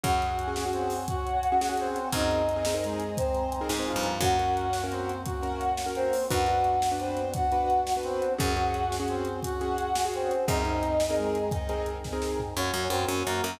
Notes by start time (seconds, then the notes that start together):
0.03 F#2 C#4 F#4 G#4 C#5 F#5 G#5, kick, closed hi-hat
0.22 closed hi-hat
0.39 closed hi-hat
0.47 C#4 F#4 G#4
0.56 C#4 F#4 G#4, snare
0.65 C#4 F#4 G#4
0.73 C4 C5, closed hi-hat
0.90 open hi-hat
1.08 F#4 F#5, kick, closed hi-hat
1.27 closed hi-hat
1.43 closed hi-hat
1.52 C#4 F#4 G#4
1.61 C#4 F#4 G#4, snare
1.69 C#4 F#4 G#4
1.77 C4 C5, closed hi-hat
1.96 closed hi-hat
2.12 F#2 C4 D#4 G#4 A#4 C5 D#5 G#5 A#5, kick, closed hi-hat
2.31 closed hi-hat
2.49 closed hi-hat
2.56 C4 D#4 G#4 A#4
2.65 C4 D#4 G#4 A#4, snare
2.74 C4 D#4 G#4 A#4
2.83 G#3 G#4, closed hi-hat
3.00 closed hi-hat
3.17 C4 C5, kick, closed hi-hat
3.34 closed hi-hat
3.52 closed hi-hat
3.61 C4 D#4 G#4 A#4
3.69 G#2 C4 D#4 G#4 A#4, snare
3.79 C4 D#4 G#4 A#4
3.86 F3 F4, closed hi-hat
3.96 G2
4.03 closed hi-hat
4.21 F#2 A#3 C#4 F#4 A#4 F#5, kick, closed hi-hat
4.39 C#4 F#4 A#4, closed hi-hat
4.57 closed hi-hat
4.73 snare
4.83 C#4 F#4 A#4
4.91 C4 C5, closed hi-hat
5.09 closed hi-hat
5.25 F#4 F#5, kick, closed hi-hat
5.43 C#4 F#4 A#4, closed hi-hat
5.61 closed hi-hat
5.77 snare
5.86 C#4 F#4 A#4
5.95 C4 C5, closed hi-hat
6.13 open hi-hat
6.30 F#2 B3 D4 F#4 B4 F#5, kick, closed hi-hat
6.47 D4 F#4 B4, closed hi-hat
6.64 closed hi-hat
6.82 snare
6.92 D4 F#4 B4
6.99 C4 C5, closed hi-hat
7.17 closed hi-hat
7.34 F#4 F#5, kick, closed hi-hat
7.52 D4 F#4 B4, closed hi-hat
7.70 closed hi-hat
7.87 snare
7.97 D4 F#4 B4
8.03 C4 C5, closed hi-hat
8.22 closed hi-hat
8.38 F#2 C#4 F#4 G#4 F#5, kick, closed hi-hat
8.57 C#4 F#4 G#4, closed hi-hat
8.74 closed hi-hat
8.92 snare
9.00 C#4 F#4 G#4
9.08 C4 C5, closed hi-hat
9.25 closed hi-hat
9.43 F#4 F#5, kick, closed hi-hat
9.61 C#4 F#4 G#4, closed hi-hat
9.78 closed hi-hat
9.95 snare
10.05 C#4 F#4 G#4
10.14 C4 C5, closed hi-hat
10.31 closed hi-hat
10.48 F#2 C4 D#4 G#4 A#4 D#5, kick, closed hi-hat
10.65 C4 D#4 G#4 A#4, closed hi-hat
10.83 closed hi-hat
11.00 snare
11.10 C4 D#4 G#4 A#4
11.16 G#3 G#4, closed hi-hat
11.35 closed hi-hat
11.51 D#4 D#5, kick, closed hi-hat
11.69 C4 D#4 G#4 A#4, closed hi-hat
11.86 closed hi-hat
12.04 kick, snare
12.13 C4 D#4 G#4 A#4
12.22 snare
12.40 floor tom
12.56 F#2 A#3 C#4 F#4 C#5
12.74 F#2 F#4
12.90 F#2 C4 A#4 C5
13.08 F#2 C#4 C#5
13.26 F#2 A#3 F#4 A#4
13.44 F#2 A#4